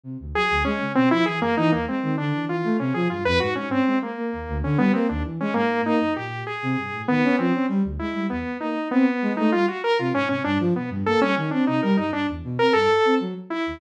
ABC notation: X:1
M:9/8
L:1/16
Q:3/8=65
K:none
V:1 name="Lead 2 (sawtooth)"
z2 ^G2 ^C2 =C E G ^A, ^D A, C2 =D2 F2 | ^C ^G F B ^F C =C2 ^A,4 ^C B, =C D z ^C | ^A,2 ^D2 G2 ^G4 B,2 C2 z2 E2 | B,2 ^D2 B,3 D F ^F ^A =F ^C C =D z B, z |
A ^C C D ^D ^A D =D z2 A =A3 z2 E2 |]
V:2 name="Flute"
C, D,, ^F, D,, ^G, ^C, B,, =F, E, ^F,, E, ^D,, G, ^D, =D, E, E, A, | C, F, G,, F,, ^G,, G,, ^C ^G, z ^A, ^D,, =D,, D, =G, A, ^D,, E, ^G, | ^G,,2 ^A, ^F,, ^A,,2 z C, =G,, =A,, ^D, ^C =F, C G, =D,, ^G, =G, | E,, z ^A, z C z ^G, =A, =G, z2 C, ^G,, C, =G,, F, B,, G,, |
^A, G, ^D, C C, G, G,, G,, E,, B,, C G,, z C ^F, z2 ^D,, |]